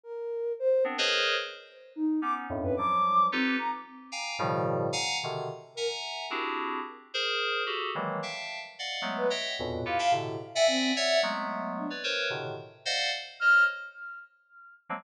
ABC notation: X:1
M:5/8
L:1/16
Q:1/4=110
K:none
V:1 name="Electric Piano 2"
z6 [B,CD] [_A_B=Bc_d_e]3 | z6 [B,_D_E]2 [F,,_G,,=G,,A,,]2 | [F,_G,=G,]4 [_EFGAB]2 z4 | [fg_a_b]2 [=A,,=B,,_D,_E,F,G,]4 [f_g_a_b]2 [=B,,C,=D,E,]2 |
z2 [e_g_a_b]4 [CDE_G=G_A]4 | z2 [_A_Bc]4 [_G=GA=A]2 [_E,=E,_G,=G,_A,_B,]2 | [efga]3 z [d_ef_g]2 [_G,_A,=A,B,]2 [_de=eg=g]2 | [E,,F,,G,,A,,_B,,=B,,]2 [EFGAB] [_e=efgab] [A,,B,,C,D,]2 z [de_g=g_a]3 |
[_d=de_g]2 [_G,_A,=A,B,]5 [B_d=d] [_B=Bc_d]2 | [A,,B,,C,D,_E,]2 z2 [cd_ef_g]2 z2 [c_de]2 | z9 [F,_G,_A,_B,C] |]
V:2 name="Ocarina"
_B4 c2 z4 | z4 _E2 d' z2 B | d'4 C2 _b z3 | z10 |
z2 _B z7 | z10 | z7 B z2 | z2 f f z3 e C2 |
e2 z4 D z3 | z8 f'2 | z10 |]